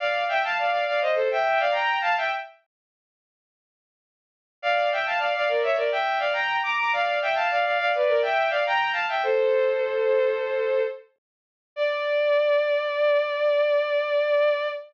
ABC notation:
X:1
M:4/4
L:1/16
Q:1/4=104
K:Dm
V:1 name="Violin"
[df]2 [eg] [fa] [df] [df] [df] [c_e] [Ac] [=eg]2 [df] [gb]2 [fa] [eg] | z16 | [df]2 [eg] [fa] [df] [df] [Bd] [^ce] [Bd] [eg]2 [df] [gb]2 [bd'] [bd'] | [df]2 [eg] [fa] [df] [df] [df] [=Bd] [_Bd] [eg]2 [df] [gb]2 [fa] [eg] |
"^rit." [Ac]12 z4 | d16 |]